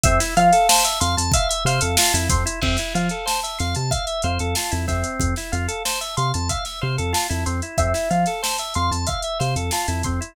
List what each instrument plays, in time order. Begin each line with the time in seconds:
0.03 synth bass 1 F2, drawbar organ C4, acoustic guitar (steel) E5, kick, closed hi-hat
0.20 drawbar organ E4, snare, closed hi-hat
0.37 synth bass 1 F3, drawbar organ F4, acoustic guitar (steel) F5, closed hi-hat
0.53 drawbar organ A4, snare, closed hi-hat
0.69 drawbar organ C5, acoustic guitar (steel) A5, snare
0.85 drawbar organ E5, closed hi-hat
1.00 synth bass 1 F2, drawbar organ F5, acoustic guitar (steel) C6, closed hi-hat
1.17 synth bass 1 F2, drawbar organ A5, closed hi-hat
1.32 acoustic guitar (steel) E5, drawbar organ F5, kick, closed hi-hat
1.49 drawbar organ E5, closed hi-hat
1.65 synth bass 1 C3, drawbar organ C5, acoustic guitar (steel) F5, snare, closed hi-hat
1.81 synth bass 1 F2, drawbar organ A4, closed hi-hat
1.97 drawbar organ F4, acoustic guitar (steel) A5, snare
2.14 synth bass 1 F2, drawbar organ E4, closed hi-hat
2.29 synth bass 1 F2, drawbar organ C4, acoustic guitar (steel) C6, kick, closed hi-hat
2.46 drawbar organ E4, closed hi-hat
2.62 synth bass 1 F2, drawbar organ C4, acoustic guitar (steel) E5, kick, crash
2.77 drawbar organ E4, snare, closed hi-hat
2.94 synth bass 1 F3, drawbar organ F4, acoustic guitar (steel) F5, closed hi-hat
3.09 drawbar organ A4, closed hi-hat
3.26 drawbar organ C5, acoustic guitar (steel) A5, snare
3.43 drawbar organ E5, closed hi-hat
3.59 synth bass 1 F2, drawbar organ F5, acoustic guitar (steel) C6, snare, closed hi-hat
3.75 synth bass 1 C3, drawbar organ A5, closed hi-hat
3.91 acoustic guitar (steel) E5, drawbar organ F5, kick, closed hi-hat
4.07 drawbar organ E5, closed hi-hat
4.22 synth bass 1 F2, drawbar organ C5, acoustic guitar (steel) F5, closed hi-hat
4.39 synth bass 1 F2, drawbar organ A4, closed hi-hat
4.55 drawbar organ F4, acoustic guitar (steel) A5, snare
4.71 synth bass 1 F2, drawbar organ E4, closed hi-hat
4.88 synth bass 1 F2, drawbar organ C4, acoustic guitar (steel) E5, kick, snare, closed hi-hat
5.04 closed hi-hat
5.20 synth bass 1 F2, kick, closed hi-hat
5.36 drawbar organ E4, snare, closed hi-hat
5.52 synth bass 1 F2, drawbar organ F4, acoustic guitar (steel) F5, closed hi-hat
5.68 drawbar organ A4, closed hi-hat
5.85 drawbar organ C5, acoustic guitar (steel) A5, snare
6.01 drawbar organ E5, closed hi-hat
6.17 synth bass 1 C3, drawbar organ F5, acoustic guitar (steel) C6, closed hi-hat
6.34 synth bass 1 F2, drawbar organ A5, closed hi-hat
6.49 acoustic guitar (steel) E5, drawbar organ F5, kick, closed hi-hat
6.65 drawbar organ E5, snare, closed hi-hat
6.81 synth bass 1 C3, drawbar organ C5, acoustic guitar (steel) F5
6.98 synth bass 1 F2, drawbar organ A4, closed hi-hat
7.13 drawbar organ F4, acoustic guitar (steel) A5, snare
7.30 synth bass 1 F2, drawbar organ E4, closed hi-hat
7.46 synth bass 1 F2, drawbar organ C4, acoustic guitar (steel) C6, closed hi-hat
7.62 drawbar organ E4, closed hi-hat
7.78 synth bass 1 F2, drawbar organ C4, acoustic guitar (steel) E5, kick, closed hi-hat
7.94 drawbar organ E4, snare, closed hi-hat
8.10 synth bass 1 F3, drawbar organ F4, acoustic guitar (steel) F5, closed hi-hat
8.26 drawbar organ A4, snare, closed hi-hat
8.42 drawbar organ C5, acoustic guitar (steel) A5, snare
8.58 drawbar organ E5, closed hi-hat
8.74 synth bass 1 F2, drawbar organ F5, acoustic guitar (steel) C6, closed hi-hat
8.91 synth bass 1 F2, drawbar organ A5, closed hi-hat
9.07 acoustic guitar (steel) E5, drawbar organ F5, kick, closed hi-hat
9.22 drawbar organ E5, closed hi-hat
9.39 synth bass 1 C3, drawbar organ C5, acoustic guitar (steel) F5, snare, closed hi-hat
9.56 synth bass 1 F2, drawbar organ A4, closed hi-hat
9.71 drawbar organ F4, acoustic guitar (steel) A5, snare
9.88 synth bass 1 F2, drawbar organ E4, closed hi-hat
10.03 synth bass 1 F2, drawbar organ C4, acoustic guitar (steel) C6, kick, closed hi-hat
10.21 drawbar organ E4, closed hi-hat